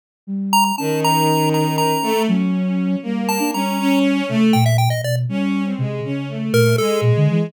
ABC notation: X:1
M:9/8
L:1/16
Q:3/8=80
K:none
V:1 name="Lead 1 (square)"
z4 _b b | a2 _b4 b2 b4 z6 | z2 a2 _b4 z4 g e g _e d z | z10 _B2 A2 z4 |]
V:2 name="Violin"
z6 | _E,10 A,2 _D6 | _B,4 _D2 D4 A,2 z6 | _D3 C _A,2 D2 =A,4 _A,6 |]
V:3 name="Flute"
z2 G,4 | _D12 _G,6 | G,3 D G,6 C,2 _B,,3 B,, =B,,2 | G,4 C,2 _D,4 _B,,2 z2 B,, =D, E,2 |]